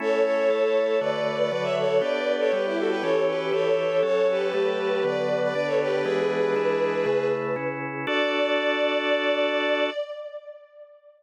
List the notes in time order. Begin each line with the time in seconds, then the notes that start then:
0.00 A3 C#4 E4 A4 C#5
0.25 A4 C#5
0.50 A3 E4 A4
1.01 D3 A3 F#4 B4 D5
1.38 B4 D5
1.51 D3 F#3 F#4 B4 D5
1.63 C#5 E5
1.78 A4 C#5
1.99 B3 D4 G4 B4 D5
2.40 A4 C#5
2.52 G3 B3 G4 B4
2.66 E4 G4
2.78 F#4 A4
2.89 G4 B4
3.02 E3 C#4 G4 A4 C#5
3.28 G4 B4
3.52 E3 E4 G4 A4 C#5
4.02 F#3 C#4 A4 C#5
4.31 G4 B4
4.53 F#3 A3 A4
5.04 D3 F#3 B3 B4 D5
5.43 B4 D5
5.54 D3 B3 D4 B4 D5
5.67 A4 C#5
5.81 G4 B4
6.04 E3 G#3 B3 D4 G#4 B4
6.56 E3 G#3 D4 E4
7.06 C#3 A3 E4
7.56 C#3 C#4 E4
8.07 D4 F#4 A4 D5